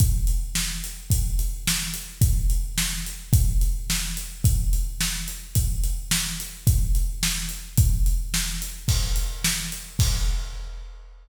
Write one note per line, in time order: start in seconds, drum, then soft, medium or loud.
0.00 kick loud
0.00 closed hi-hat loud
0.27 closed hi-hat medium
0.55 snare loud
0.84 closed hi-hat medium
1.10 kick loud
1.10 closed hi-hat loud
1.39 closed hi-hat medium
1.67 snare loud
1.94 closed hi-hat medium
2.21 kick loud
2.21 closed hi-hat loud
2.50 closed hi-hat medium
2.78 snare loud
3.06 closed hi-hat medium
3.33 kick loud
3.33 closed hi-hat loud
3.61 closed hi-hat medium
3.90 snare loud
4.17 closed hi-hat medium
4.44 kick loud
4.44 closed hi-hat loud
4.73 closed hi-hat medium
5.01 snare loud
5.28 closed hi-hat medium
5.55 kick loud
5.55 closed hi-hat loud
5.84 closed hi-hat medium
6.11 snare loud
6.40 closed hi-hat medium
6.67 kick loud
6.67 closed hi-hat loud
6.95 closed hi-hat medium
7.23 snare loud
7.49 closed hi-hat medium
7.77 kick loud
7.77 closed hi-hat loud
8.06 closed hi-hat medium
8.34 snare loud
8.62 closed hi-hat medium
8.88 kick loud
8.88 crash loud
9.16 closed hi-hat medium
9.44 snare loud
9.72 closed hi-hat medium
9.99 kick loud
9.99 crash loud